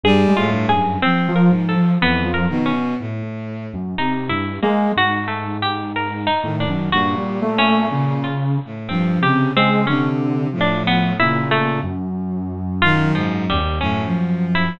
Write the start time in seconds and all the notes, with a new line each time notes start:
0.04 G2 G3 G#4
0.28 G#3
0.37 A2 F4
0.53 G2
0.69 F#2 G#4
1.02 F3 C4
1.28 F3
1.36 A#4
1.51 G#2
1.69 A4
1.76 F3
2.01 F2 E3 B3
2.24 F3
2.34 A#4
2.50 B2 D#3
2.66 C#4
3.00 A2
3.73 F#2
3.98 C3 D#4
4.30 G2 E4
4.63 G#3 A#3
4.96 G#2 F#4
5.28 A3
5.62 G4
5.96 A#4
6.27 D#4
6.43 A2 D#3
6.60 D4
6.68 F#2
6.92 G2 A#2 F#4
7.17 G3
7.42 A3
7.58 C#4
7.92 C#3
8.24 F4
8.65 A2
8.89 G2 F3 C4
9.21 C3 C#3 G4
9.55 C#3 G#3 C4
9.87 C3 D3 C#4
10.53 A2 F3
10.61 D4
10.87 B3
11.20 A#2 C#3 E4
11.51 A3
11.83 F#2
12.82 D#3 F4
13.15 G#2 F3
13.49 D#2 G3
13.81 F#2 A2 C#4
14.05 F3
14.55 E4